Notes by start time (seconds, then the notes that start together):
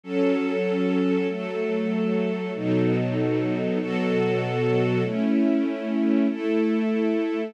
0.03 F#3 C#4 A4
1.29 F#3 A3 A4
2.55 B2 F#3 D#4 A4
3.80 B2 F#3 F#4 A4
5.04 A3 C#4 E4
6.30 A3 E4 A4